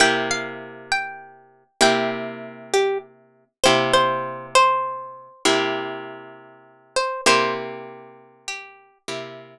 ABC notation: X:1
M:12/8
L:1/8
Q:3/8=66
K:C
V:1 name="Acoustic Guitar (steel)"
g f2 g3 g z2 G z2 | c c2 c3 z5 c | c z3 G2 z6 |]
V:2 name="Acoustic Guitar (steel)"
[C,_B,EG]6 [C,B,EG]6 | [C,_B,EG]6 [C,B,EG]6 | [C,_B,EG]6 [C,B,EG]6 |]